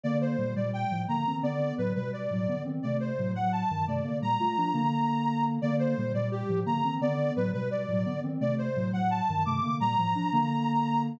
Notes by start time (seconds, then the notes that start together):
0.03 D3 A#3 D5
0.21 C5
0.38 A#2 G3
0.56 A#2 G3 D5
0.73 G5
0.91 A2 F3
1.08 D3 A#3 A#5
1.27 D#3 C4
1.43 D3 B3 D5
1.78 A2 F#3 B4
1.95 B2 G3 B4
2.13 D5
2.31 A2 F#3
2.48 D3 B3
2.65 D#3 C4
2.83 C3 A3 D5
3.00 C5
3.18 A2 F#3
3.34 A2 F#3 F#5
3.52 A5
3.70 G2 D#3
3.87 C3 A3 D5
4.04 D3 A#3
4.22 A#2 G3 A#5
4.40 A3 F4
4.57 F3 D4
4.74 D3 A#3
5.62 D3 A#3 D5
5.79 C5
5.97 A#2 G3
6.14 A#2 G3 D5
6.31 G4
6.49 A2 F3
6.66 D3 A#3 A#5
6.84 D#3 C4
7.01 D3 B3 D5
7.36 A2 F#3 B4
7.53 B2 G3 B4
7.71 D5
7.88 A2 F#3
8.06 D3 B3
8.23 D#3 C4
8.40 C3 A3 D5
8.58 C5
8.76 A2 F#3
8.92 A2 F#3 F#5
9.11 A5
9.29 G2 D#3
9.45 C3 A3 D6
9.62 D3 A#3
9.80 A#2 G3 A#5
9.98 A2 F3
10.15 F3 D4
10.32 D3 A#3